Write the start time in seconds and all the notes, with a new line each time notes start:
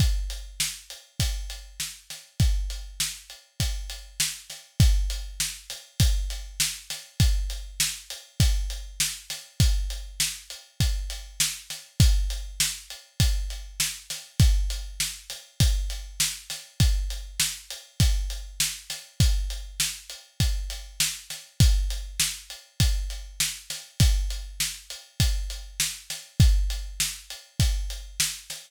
0.00 kick, closed hi-hat
0.30 closed hi-hat
0.60 snare
0.90 closed hi-hat
1.20 kick, closed hi-hat
1.50 closed hi-hat
1.80 snare
2.10 snare, closed hi-hat
2.40 kick, closed hi-hat
2.70 closed hi-hat
3.00 snare
3.30 closed hi-hat
3.60 kick, closed hi-hat
3.90 closed hi-hat
4.20 snare
4.50 snare, closed hi-hat
4.80 kick, closed hi-hat
5.10 closed hi-hat
5.40 snare
5.70 snare, closed hi-hat
6.00 kick, closed hi-hat
6.30 closed hi-hat
6.60 snare
6.90 snare, closed hi-hat
7.20 kick, closed hi-hat
7.50 closed hi-hat
7.80 snare
8.10 closed hi-hat
8.40 kick, closed hi-hat
8.70 closed hi-hat
9.00 snare
9.30 snare, closed hi-hat
9.60 kick, closed hi-hat
9.90 closed hi-hat
10.20 snare
10.50 closed hi-hat
10.80 kick, closed hi-hat
11.10 closed hi-hat
11.40 snare
11.70 snare, closed hi-hat
12.00 kick, closed hi-hat
12.30 closed hi-hat
12.60 snare
12.90 closed hi-hat
13.20 kick, closed hi-hat
13.50 closed hi-hat
13.80 snare
14.10 snare, closed hi-hat
14.40 kick, closed hi-hat
14.70 closed hi-hat
15.00 snare
15.30 snare, closed hi-hat
15.60 kick, closed hi-hat
15.90 closed hi-hat
16.20 snare
16.50 snare, closed hi-hat
16.80 kick, closed hi-hat
17.10 closed hi-hat
17.40 snare
17.70 closed hi-hat
18.00 kick, closed hi-hat
18.30 closed hi-hat
18.60 snare
18.90 snare, closed hi-hat
19.20 kick, closed hi-hat
19.50 closed hi-hat
19.80 snare
20.10 closed hi-hat
20.40 kick, closed hi-hat
20.70 closed hi-hat
21.00 snare
21.30 snare, closed hi-hat
21.60 kick, closed hi-hat
21.90 closed hi-hat
22.20 snare
22.50 closed hi-hat
22.80 kick, closed hi-hat
23.10 closed hi-hat
23.40 snare
23.70 snare, closed hi-hat
24.00 kick, closed hi-hat
24.30 closed hi-hat
24.60 snare
24.90 closed hi-hat
25.20 kick, closed hi-hat
25.50 closed hi-hat
25.80 snare
26.10 snare, closed hi-hat
26.40 kick, closed hi-hat
26.70 closed hi-hat
27.00 snare
27.30 closed hi-hat
27.60 kick, closed hi-hat
27.90 closed hi-hat
28.20 snare
28.50 snare, closed hi-hat